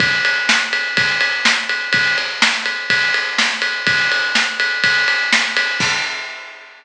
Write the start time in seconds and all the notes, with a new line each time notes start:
0.00 kick, ride
0.25 ride
0.49 snare
0.73 ride
0.97 kick, ride
1.21 ride
1.45 snare
1.69 ride
1.93 kick, ride
2.18 ride
2.42 snare
2.66 ride
2.90 kick, ride
3.14 ride
3.38 snare
3.62 ride
3.87 kick, ride
4.12 ride
4.35 snare
4.60 ride
4.84 kick, ride
5.08 ride
5.33 snare
5.57 ride
5.80 kick, crash